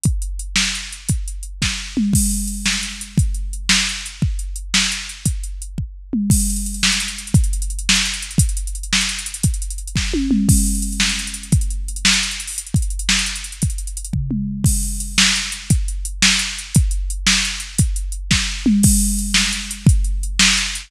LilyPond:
\new DrumStaff \drummode { \time 6/8 \tempo 4. = 115 <hh bd>8 hh8 hh8 sn8 hh8 hh8 | <hh bd>8 hh8 hh8 <bd sn>4 toml8 | <cymc bd>8 hh8 hh8 sn8 hh8 hh8 | <hh bd>8 hh8 hh8 sn8 hh8 hh8 |
bd8 hh8 hh8 sn8 hh8 hh8 | <hh bd>8 hh8 hh8 bd4 toml8 | <cymc bd>16 hh16 hh16 hh16 hh16 hh16 sn16 hh16 hh16 hh16 hh16 hh16 | <hh bd>16 hh16 hh16 hh16 hh16 hh16 sn16 hh16 hh16 hh16 hh16 hh16 |
<hh bd>16 hh16 hh16 hh16 hh16 hh16 sn16 hh16 hh16 hh16 hh16 hh16 | <hh bd>16 hh16 hh16 hh16 hh16 hh16 <bd sn>8 tommh8 toml8 | <cymc bd>16 hh16 hh16 hh16 hh16 hh16 sn16 hh16 hh16 hh16 hh16 hh16 | <hh bd>16 hh16 hh8 hh16 hh16 sn16 hh16 hh16 hh16 hh16 hho16 |
hh16 hh16 <hh bd>16 hh16 hh16 hh16 sn16 hh16 hh16 hh16 hh16 hh16 | <hh bd>16 hh16 hh16 hh16 hh16 hh16 <bd tomfh>8 toml4 | <cymc bd>8 hh8 hh8 sn8 hh8 hh8 | <hh bd>8 hh8 hh8 sn8 hh8 hh8 |
<hh bd>8 hh8 hh8 sn8 hh8 hh8 | <hh bd>8 hh8 hh8 <bd sn>4 toml8 | <cymc bd>8 hh8 hh8 sn8 hh8 hh8 | <hh bd>8 hh8 hh8 sn8 hh8 hh8 | }